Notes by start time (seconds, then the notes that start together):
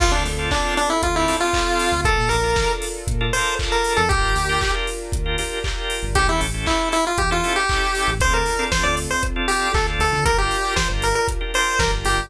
0.00 D2 C4 D4 F4 A4, kick, crash
0.12 D2 D4
0.26 D2, open hi-hat
0.39 C4 D4 F4 A4
0.51 D4, kick, clap
0.77 D4, open hi-hat
0.90 E4
1.03 D2 F4, kick, closed hi-hat
1.15 C4 D4 E4 F4 A4
1.28 C4 D4 F4 A4, open hi-hat
1.40 F4
1.53 C4 D4 F4 A4, kick, clap
1.79 open hi-hat
1.92 D2
2.05 A#1 D4 F4 A4 A#4, kick, closed hi-hat
2.18 A#2
2.29 A#1 A#4, open hi-hat
2.43 D4 F4 A4 A#4
2.56 kick, snare
2.82 open hi-hat
3.07 A#2, kick, closed hi-hat
3.21 D4 F4 A4 A#4
3.33 D4 F4 A4 A#4 C5, open hi-hat
3.59 D4 F4 A4 A#4, kick, clap
3.72 A#4
3.84 open hi-hat
3.97 F2 A4
4.09 G1 D4 F4 G4 A#4, kick, closed hi-hat
4.23 G1
4.35 D2, open hi-hat
4.49 D4 F4 G4 A#4
4.61 kick, clap
4.87 open hi-hat
5.12 D2, kick, closed hi-hat
5.26 D4 F4 G4 A#4
5.38 D4 F4 G4 A#4, open hi-hat
5.64 D4 F4 G4 A#4, kick, clap
5.90 open hi-hat
6.03 G1
6.15 A1 C#4 E4 G4 A4, kick, closed hi-hat
6.27 E2 E4
6.41 A1, open hi-hat
6.54 C#4 E4 G4 A4
6.66 E4, kick, clap
6.92 E4, open hi-hat
7.07 F4
7.18 E2 G4, kick, closed hi-hat
7.31 C#4 E4 F4 G4 A4
7.43 C#4 E4 G4 A4, open hi-hat
7.56 G4
7.69 C#4 E4 G4 A4, kick, clap
7.95 open hi-hat
8.08 A1
8.20 D2 C4 D4 F4 A4 C5, kick, closed hi-hat
8.34 A#4
8.46 open hi-hat
8.59 C4 D4 F4 A4
8.72 C5, kick, snare
8.83 D2 D5
8.97 open hi-hat
9.11 C5
9.23 kick, closed hi-hat
9.36 C4 D4 F4 A4
9.48 C4 D4 F4 G4 A4, open hi-hat
9.74 D2 C4 D4 F4 A4, kick, clap
9.99 D2 A4, open hi-hat
10.13 D3
10.25 G1 D4 F4 G4 A#4, kick, closed hi-hat
10.38 G4
10.51 open hi-hat
10.64 D4 F4 G4 A#4
10.76 C5, kick, snare
10.90 G1
11.02 A#4, open hi-hat
11.15 A#4
11.28 kick, closed hi-hat
11.41 D4 F4 G4 A#4
11.54 D4 F4 G4 A#4 C5, open hi-hat
11.79 G1 D4 F4 G4 A#4, kick, snare
12.05 G1 G4, open hi-hat
12.18 G1